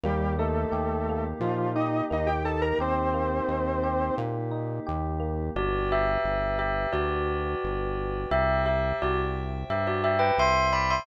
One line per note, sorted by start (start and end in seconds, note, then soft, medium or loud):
0.03 0.66 D#2 loud
0.03 0.34 G3 medium
0.03 1.09 A#3 loud
0.03 5.51 A#3 medium
0.03 5.51 D#4 medium
0.03 5.51 G4 loud
0.03 0.34 G4 medium
0.39 1.24 A3 medium
0.39 1.43 D#4 medium
0.39 1.24 A4 medium
0.72 1.34 D#2 medium
0.72 1.75 G4 medium
1.09 2.10 A#3 medium
1.40 2.02 A#2 medium
1.40 1.72 F3 medium
1.40 2.44 D#4 medium
1.40 1.72 F4 medium
1.75 2.05 D#4 medium
1.75 2.80 G4 medium
1.75 2.05 D#5 medium
2.10 2.73 D#2 medium
2.10 3.13 A#3 medium
2.10 2.29 D#4 medium
2.10 2.29 D#5 medium
2.27 2.43 G4 medium
2.27 2.43 G5 medium
2.45 3.48 D#4 medium
2.45 2.61 A4 medium
2.45 2.61 A5 medium
2.62 2.78 A#4 medium
2.62 2.78 A#5 medium
2.79 3.41 D#2 medium
2.79 4.15 C4 medium
2.79 3.83 G4 medium
2.79 4.15 C5 loud
3.14 4.18 A#3 medium
3.48 4.11 D#2 medium
3.48 4.51 D#4 medium
3.83 4.86 G4 medium
4.18 4.80 A#2 medium
4.18 5.19 A#3 medium
4.51 5.50 D#4 medium
4.86 5.50 D#2 loud
4.86 5.52 G4 medium
5.20 5.52 A#3 medium
5.55 6.18 G1 loud
5.55 5.89 F#4 medium
5.55 8.29 B4 medium
5.55 5.89 D5 medium
5.55 8.29 D5 medium
5.55 8.29 G5 medium
5.92 6.58 G4 medium
5.92 6.58 E5 medium
6.24 6.86 G1 medium
6.59 6.88 G4 medium
6.59 6.88 E5 medium
6.93 7.55 D2 medium
6.93 8.22 F#4 medium
6.93 8.22 D5 medium
7.64 8.26 G1 medium
8.31 8.93 C2 loud
8.31 8.61 G4 medium
8.31 11.04 C5 medium
8.31 11.04 E5 medium
8.31 8.61 E5 medium
8.31 11.04 G5 medium
8.66 8.96 G4 medium
8.66 8.96 E5 medium
9.02 9.64 C2 medium
9.02 9.18 F#4 medium
9.02 9.18 D5 medium
9.70 10.32 G2 medium
9.70 9.86 G4 medium
9.70 9.86 E5 medium
9.87 10.04 F#4 medium
9.87 10.04 D5 medium
10.04 10.20 G4 medium
10.04 10.20 E5 medium
10.19 10.35 B4 medium
10.19 10.35 G5 medium
10.38 11.00 C2 medium
10.38 10.68 E5 medium
10.38 10.68 C6 medium
10.73 10.89 D5 medium
10.73 10.89 B5 medium
10.90 11.06 E5 medium
10.90 11.06 C6 medium